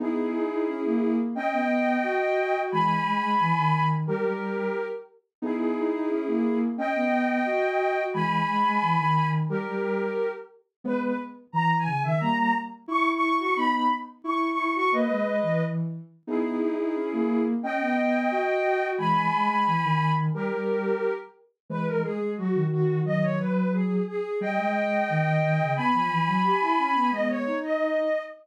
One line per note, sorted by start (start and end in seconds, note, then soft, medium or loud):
0.00 0.33 B3 medium
0.00 0.33 D#4 medium
0.00 1.14 E4 medium
0.00 1.14 G#4 medium
0.34 0.47 D#4 medium
0.51 0.67 D#4 medium
0.67 0.82 C#4 medium
0.84 1.27 A#3 medium
1.35 1.50 C#4 medium
1.35 2.58 D#5 medium
1.35 2.58 G5 medium
1.52 1.97 B3 medium
2.03 2.34 F#4 medium
2.37 2.52 F#4 medium
2.54 2.70 F#4 medium
2.71 3.00 E3 medium
2.71 3.00 G#3 medium
2.71 3.84 G#5 medium
2.71 3.84 B5 medium
3.05 3.21 G#3 medium
3.22 3.35 G#3 medium
3.39 3.53 E3 medium
3.56 4.02 D#3 medium
4.07 4.24 G3 medium
4.07 4.85 G4 medium
4.07 4.85 A#4 medium
4.24 4.65 G3 medium
5.42 5.75 B3 medium
5.42 5.75 D#4 medium
5.42 6.57 E4 medium
5.42 6.57 G#4 medium
5.76 5.90 D#4 medium
5.93 6.09 D#4 medium
6.10 6.24 C#4 medium
6.27 6.69 A#3 medium
6.77 6.92 C#4 medium
6.77 8.01 D#5 medium
6.77 8.01 G5 medium
6.94 7.39 B3 medium
7.46 7.77 F#4 medium
7.79 7.95 F#4 medium
7.96 8.12 F#4 medium
8.13 8.42 E3 medium
8.13 8.42 G#3 medium
8.13 9.26 G#5 medium
8.13 9.26 B5 medium
8.47 8.63 G#3 medium
8.65 8.78 G#3 medium
8.81 8.95 E3 medium
8.99 9.45 D#3 medium
9.49 9.65 G3 medium
9.49 10.27 G4 medium
9.49 10.27 A#4 medium
9.66 10.07 G3 medium
10.84 11.13 G#3 medium
10.84 11.13 B3 medium
10.84 11.00 B4 medium
11.02 11.17 B4 medium
11.52 11.86 E3 medium
11.52 11.75 A#5 medium
11.78 12.01 G#5 medium
11.87 12.02 C#3 medium
12.03 12.20 D#3 medium
12.03 12.19 E5 medium
12.20 12.52 G3 medium
12.20 12.52 A#3 medium
12.20 12.37 A#5 medium
12.38 12.53 A#5 medium
12.88 13.20 E4 medium
12.88 13.08 C#6 medium
13.14 13.38 C#6 medium
13.22 13.36 E4 medium
13.39 13.54 F#4 medium
13.39 13.54 C#6 medium
13.56 13.87 B3 medium
13.56 13.87 D#4 medium
13.56 13.71 B5 medium
13.73 13.87 B5 medium
14.24 14.52 E4 medium
14.24 14.47 C#6 medium
14.50 14.73 C#6 medium
14.58 14.72 E4 medium
14.75 14.91 F#4 medium
14.75 14.88 C#6 medium
14.91 15.07 A#3 medium
14.91 15.61 B4 medium
14.91 15.61 D#5 medium
15.08 15.40 G#3 medium
15.43 15.88 E3 medium
16.27 16.60 B3 medium
16.27 16.60 D#4 medium
16.27 17.42 E4 medium
16.27 17.42 G#4 medium
16.61 16.75 D#4 medium
16.78 16.93 D#4 medium
16.95 17.09 C#4 medium
17.12 17.55 A#3 medium
17.63 17.77 C#4 medium
17.63 18.86 D#5 medium
17.63 18.86 G5 medium
17.80 18.24 B3 medium
18.31 18.62 F#4 medium
18.64 18.80 F#4 medium
18.81 18.97 F#4 medium
18.98 19.26 E3 medium
18.98 19.26 G#3 medium
18.98 20.11 G#5 medium
18.98 20.11 B5 medium
19.32 19.49 G#3 medium
19.49 19.63 G#3 medium
19.67 19.81 E3 medium
19.83 20.29 D#3 medium
20.34 20.50 G3 medium
20.34 21.12 G4 medium
20.34 21.12 A#4 medium
20.51 20.92 G3 medium
21.69 22.01 E3 medium
21.69 22.01 G#3 medium
21.69 21.85 B4 medium
21.87 22.01 A#4 medium
22.03 22.19 G#3 medium
22.03 22.30 G#4 medium
22.20 22.35 G#3 medium
22.37 22.52 F#3 medium
22.37 22.64 F#4 medium
22.54 23.00 D#3 medium
22.71 22.99 F#4 medium
23.04 23.34 D#3 medium
23.04 23.34 F#3 medium
23.04 23.20 D#5 medium
23.22 23.38 C#5 medium
23.39 23.96 F#3 medium
23.39 23.71 B4 medium
23.72 24.02 G#4 medium
24.07 24.37 G#4 medium
24.41 24.56 G3 medium
24.41 25.71 D#5 medium
24.41 25.71 G5 medium
24.57 25.04 G#3 medium
25.09 25.41 D#3 medium
25.42 25.58 D#3 medium
25.59 25.75 C#3 medium
25.76 25.91 B3 medium
25.76 27.07 G#5 medium
25.76 27.07 B5 medium
25.94 26.08 F3 medium
26.11 26.25 E3 medium
26.27 26.43 F#3 medium
26.44 26.60 G4 medium
26.61 26.75 E4 medium
26.78 26.92 C#4 medium
26.95 27.11 B3 medium
27.11 27.43 G#3 medium
27.11 27.43 B3 medium
27.11 27.27 D#5 medium
27.29 27.56 C#5 medium
27.46 28.02 D#4 medium
27.63 28.19 D#5 medium